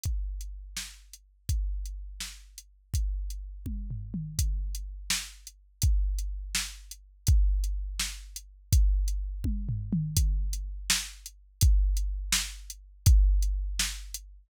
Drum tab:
HH |x--x-----x--|x--x-----x--|x--x--------|x--x-----x--|
SD |------o-----|------o-----|------------|------o-----|
T1 |------------|------------|------o-----|------------|
T2 |------------|------------|----------o-|------------|
FT |------------|------------|--------o---|------------|
BD |o-----------|o-----------|o-----o-----|o-----------|

HH |x--x-----x--|x--x-----x--|x--x--------|x--x-----x--|
SD |------o-----|------o-----|------------|------o-----|
T1 |------------|------------|------o-----|------------|
T2 |------------|------------|----------o-|------------|
FT |------------|------------|--------o---|------------|
BD |o-----------|o-----------|o-----o-----|o-----------|

HH |x--x-----x--|x--x-----x--|
SD |------o-----|------o-----|
T1 |------------|------------|
T2 |------------|------------|
FT |------------|------------|
BD |o-----------|o-----------|